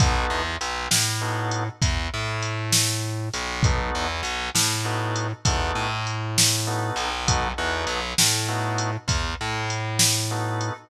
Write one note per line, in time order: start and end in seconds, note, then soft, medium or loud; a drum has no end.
0.00 0.25 B1 loud
0.00 0.42 B3 loud
0.00 0.42 D#4 loud
0.00 0.42 F#4 medium
0.00 0.42 A4 loud
0.00 kick loud
0.00 closed hi-hat loud
0.30 0.56 E2 medium
0.61 0.87 B1 loud
0.61 closed hi-hat medium
0.91 1.68 A2 loud
0.91 snare loud
1.21 1.64 B3 medium
1.21 1.64 D#4 medium
1.21 1.64 F#4 medium
1.21 1.64 A4 medium
1.51 closed hi-hat medium
1.82 2.07 E2 loud
1.82 kick loud
1.82 closed hi-hat loud
2.14 3.29 A2 loud
2.42 closed hi-hat medium
2.72 snare loud
3.34 3.90 B1 loud
3.34 closed hi-hat medium
3.63 4.07 B3 medium
3.63 4.07 D#4 loud
3.63 4.07 F#4 medium
3.63 4.07 A4 medium
3.63 kick loud
3.63 closed hi-hat medium
3.95 4.21 E2 loud
4.23 4.49 B1 medium
4.23 closed hi-hat medium
4.55 5.32 A2 loud
4.55 snare loud
4.85 5.27 B3 medium
4.85 5.27 D#4 medium
4.85 5.27 F#4 medium
4.85 5.27 A4 medium
5.16 closed hi-hat medium
5.45 5.71 E2 loud
5.45 5.88 B3 medium
5.45 5.88 D#4 medium
5.45 5.88 F#4 medium
5.45 5.88 A4 medium
5.45 kick loud
5.45 closed hi-hat loud
5.75 6.90 A2 medium
6.07 closed hi-hat medium
6.38 snare loud
6.67 7.09 B3 medium
6.67 7.09 D#4 medium
6.67 7.09 F#4 medium
6.67 7.09 A4 medium
6.96 7.52 B1 loud
6.96 closed hi-hat medium
7.27 7.48 B3 loud
7.27 7.48 D#4 loud
7.27 7.48 F#4 loud
7.27 7.48 A4 loud
7.27 kick loud
7.27 closed hi-hat loud
7.58 7.84 E2 medium
7.58 8.00 B3 medium
7.58 8.00 D#4 medium
7.58 8.00 F#4 loud
7.58 8.00 A4 medium
7.87 8.13 B1 loud
7.87 closed hi-hat medium
8.18 8.96 A2 loud
8.18 snare loud
8.48 8.91 B3 medium
8.48 8.91 D#4 medium
8.48 8.91 F#4 medium
8.48 8.91 A4 medium
8.78 closed hi-hat medium
9.08 9.33 E2 loud
9.08 kick medium
9.08 closed hi-hat loud
9.41 10.70 A2 loud
9.70 closed hi-hat medium
9.99 snare loud
10.31 10.73 B3 medium
10.31 10.73 D#4 medium
10.31 10.73 F#4 medium
10.31 10.73 A4 medium
10.61 closed hi-hat medium